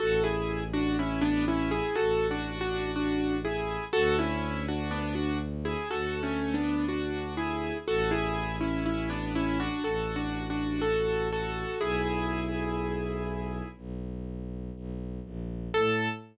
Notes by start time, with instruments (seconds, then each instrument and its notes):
0.00 violin A1, acoustic grand piano F#4 A4
0.24 acoustic grand piano E4 G#4
0.73 acoustic grand piano D4 F#4
0.99 acoustic grand piano C#4 E4
1.22 acoustic grand piano B3 D4
1.48 acoustic grand piano C#4 E4
1.71 acoustic grand piano E4 G#4
1.95 violin A1, acoustic grand piano F#4 A4
2.31 acoustic grand piano D4 F#4
2.61 acoustic grand piano D4 F#4
2.96 acoustic grand piano D4 F#4
3.45 acoustic grand piano E4 G#4
3.93 violin D2, acoustic grand piano F#4 A4
4.19 acoustic grand piano C#4 E4
4.68 acoustic grand piano D4 F#4
4.91 acoustic grand piano B3 D4
5.15 acoustic grand piano D4 F#4
5.65 acoustic grand piano E4 G#4
5.90 violin D2, acoustic grand piano F#4 A4
6.23 acoustic grand piano A3 C#4
6.54 acoustic grand piano B3 D4
6.88 acoustic grand piano D4 F#4
7.37 acoustic grand piano E4 G#4
7.87 violin A1, acoustic grand piano F#4 A4
8.11 acoustic grand piano E4 G#4
8.61 acoustic grand piano C#4 E4
8.86 acoustic grand piano C#4 E4
9.10 acoustic grand piano B3 D4
9.35 acoustic grand piano C#4 E4
9.60 acoustic grand piano D4 F#4
9.84 violin A1, acoustic grand piano F#4 A4
10.16 acoustic grand piano D4 F#4
10.50 acoustic grand piano D4 F#4
10.82 acoustic grand piano F#4 A4
11.33 acoustic grand piano F#4 A4
11.81 violin B1, acoustic grand piano E4 G#4
13.77 violin B1
14.76 violin B1
15.25 violin A#1
15.74 violin A2, acoustic grand piano A4